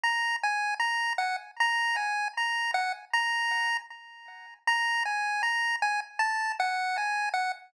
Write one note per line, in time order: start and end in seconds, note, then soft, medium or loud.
0.04 0.36 A#5 medium
0.43 0.75 G#5 loud
0.80 1.13 A#5 medium
1.18 1.36 F#5 medium
1.60 1.96 A#5 loud
1.96 2.28 G#5 medium
2.37 2.71 A#5 medium
2.74 2.92 F#5 loud
3.13 3.77 A#5 loud
4.67 5.03 A#5 loud
5.05 5.42 G#5 medium
5.43 5.76 A#5 loud
5.82 6.00 G#5 loud
6.19 6.52 A5 loud
6.60 6.97 F#5 loud
6.98 7.29 G#5 medium
7.34 7.52 F#5 medium